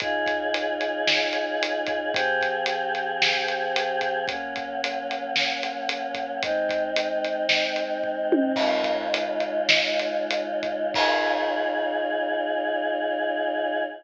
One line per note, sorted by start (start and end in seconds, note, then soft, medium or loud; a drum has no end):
0.00 2.11 C#3 loud
0.00 2.11 D#4 loud
0.00 2.11 F4 medium
0.00 2.11 G#4 loud
0.00 kick loud
0.00 closed hi-hat medium
0.26 kick medium
0.26 closed hi-hat medium
0.54 closed hi-hat medium
0.81 closed hi-hat medium
1.07 snare loud
1.33 closed hi-hat medium
1.63 closed hi-hat loud
1.86 kick medium
1.86 closed hi-hat medium
2.12 4.25 F3 loud
2.12 4.25 C4 loud
2.12 4.25 G4 medium
2.12 4.25 G#4 medium
2.12 kick loud
2.12 closed hi-hat loud
2.41 kick medium
2.41 closed hi-hat medium
2.66 closed hi-hat loud
2.95 closed hi-hat medium
3.22 snare loud
3.48 closed hi-hat medium
3.76 closed hi-hat loud
4.01 kick medium
4.01 closed hi-hat medium
4.27 6.40 F#3 medium
4.27 6.40 A#3 loud
4.27 6.40 C#4 medium
4.27 kick medium
4.27 closed hi-hat medium
4.56 kick medium
4.56 closed hi-hat medium
4.84 closed hi-hat loud
5.11 closed hi-hat medium
5.36 snare medium
5.63 closed hi-hat medium
5.89 closed hi-hat loud
6.15 kick medium
6.15 closed hi-hat medium
6.43 8.55 G#3 medium
6.43 8.55 C4 loud
6.43 8.55 D#4 medium
6.43 kick loud
6.43 closed hi-hat medium
6.69 kick medium
6.69 closed hi-hat medium
6.96 closed hi-hat loud
7.24 closed hi-hat medium
7.49 snare medium
7.76 closed hi-hat medium
8.04 kick medium
8.32 high tom loud
8.56 10.92 C#3 loud
8.56 10.92 G#3 loud
8.56 10.92 D#4 medium
8.56 10.92 F4 loud
8.56 kick medium
8.56 crash medium
8.84 kick medium
8.84 closed hi-hat medium
9.14 closed hi-hat loud
9.40 closed hi-hat medium
9.69 snare loud
9.99 closed hi-hat medium
10.31 closed hi-hat loud
10.63 kick medium
10.63 closed hi-hat medium
10.94 13.82 C#3 loud
10.94 13.82 D#4 loud
10.94 13.82 F4 loud
10.94 13.82 G#4 loud
10.94 kick loud
10.94 crash loud